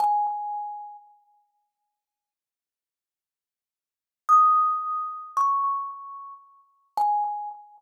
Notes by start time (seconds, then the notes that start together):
0.00 G#5
4.29 D#6
5.37 C#6
6.97 G#5